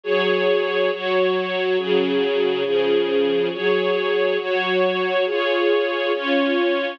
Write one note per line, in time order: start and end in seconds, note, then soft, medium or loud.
0.04 0.90 F#3 medium
0.04 0.90 G#4 medium
0.04 0.90 C#5 medium
0.91 1.77 F#3 medium
0.91 1.77 F#4 medium
0.91 1.77 C#5 medium
1.77 2.63 C#3 medium
1.77 2.64 F#3 medium
1.77 2.63 G#4 medium
2.63 3.49 C#3 medium
2.63 3.49 F3 medium
2.63 3.49 G#4 medium
3.52 4.38 F#3 medium
3.52 4.38 G#4 medium
3.52 4.38 C#5 medium
4.38 5.25 F#3 medium
4.38 5.25 F#4 medium
4.38 5.25 C#5 medium
5.25 6.12 F4 medium
5.25 6.12 G#4 medium
5.25 6.12 C#5 medium
6.12 6.99 C#4 medium
6.12 6.99 F4 medium
6.12 6.99 C#5 medium